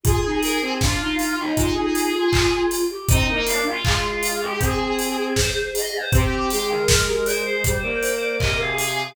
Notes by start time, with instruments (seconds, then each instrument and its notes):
0.03 choir aahs F4 G#4, kick, closed hi-hat
0.25 choir aahs D#4
0.43 choir aahs A#4, open hi-hat
0.62 choir aahs C4
0.81 choir aahs D4 F4, kick, snare
1.01 choir aahs D#4
1.19 choir aahs F4, open hi-hat
1.38 choir aahs D#4
1.56 choir aahs F4 G#4, kick, closed hi-hat
1.75 choir aahs D#4
1.95 open hi-hat
2.15 choir aahs F4
2.33 choir aahs F4, kick, clap
2.53 choir aahs F4
2.71 open hi-hat
2.90 choir aahs G4
3.09 choir aahs C4 D#4 D#5, kick, closed hi-hat
3.28 choir aahs A#3 D#4
3.46 choir aahs D4 F5, open hi-hat
3.66 choir aahs F4
3.84 choir aahs G#3, kick, clap
4.22 choir aahs F4, open hi-hat
4.41 choir aahs G4
4.60 choir aahs C4 G#4, kick, closed hi-hat
4.99 open hi-hat
5.36 choir aahs C5, kick, snare
5.75 choir aahs D#5, open hi-hat
5.94 choir aahs C5
6.12 choir aahs C4 G4, kick, closed hi-hat
6.50 choir aahs G#3 G#4, open hi-hat
6.70 choir aahs A#4
6.88 kick, snare
7.07 choir aahs G4
7.26 choir aahs A#4 C5, open hi-hat
7.45 choir aahs C5
7.64 choir aahs G3 C5, kick, closed hi-hat
7.82 choir aahs A#3 D5
8.03 open hi-hat
8.21 choir aahs D5
8.40 choir aahs C3 A#4 D#5, kick, clap
8.59 choir aahs G#4 F5
8.78 open hi-hat